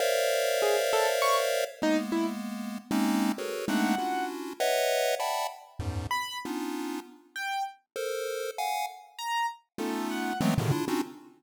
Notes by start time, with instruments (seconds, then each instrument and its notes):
0.00 lead 1 (square) A#4 C5 C#5 D5 E5 F5
0.62 acoustic grand piano G#4
0.93 acoustic grand piano A4
1.22 acoustic grand piano C#6
1.82 lead 1 (square) G#3 A#3 B3, acoustic grand piano D#4
2.12 acoustic grand piano E4
2.91 lead 1 (square) G#3 A#3 C4 C#4 D#4
3.38 lead 1 (square) F#4 G#4 A4 A#4 B4 C#5
3.68 lead 1 (square) G#3 A3 A#3 C4 D4 D#4, acoustic grand piano F#5
3.98 lead 1 (square) C#4 D4 E4 F4 F#4
4.60 lead 1 (square) B4 C#5 D#5 E5 F#5
5.20 lead 1 (square) D5 E5 F#5 G5 A5 B5
5.79 lead 1 (square) E2 F#2 G#2
6.11 acoustic grand piano B5
6.45 lead 1 (square) B3 C#4 D4 D#4 F4
7.36 acoustic grand piano G5
7.96 lead 1 (square) A4 A#4 C5
8.58 lead 1 (square) F5 F#5 G#5
9.19 acoustic grand piano A#5
9.78 lead 1 (square) A3 B3 C#4 D#4 F4, acoustic grand piano A4
10.11 acoustic grand piano F#5
10.41 lead 1 (square) E3 F#3 G#3 A3 B3 C4
10.58 lead 1 (square) A2 B2 C3 C#3 D3 D#3
10.72 lead 1 (square) D4 E4 F4
10.88 lead 1 (square) C4 C#4 D4 D#4 F4 F#4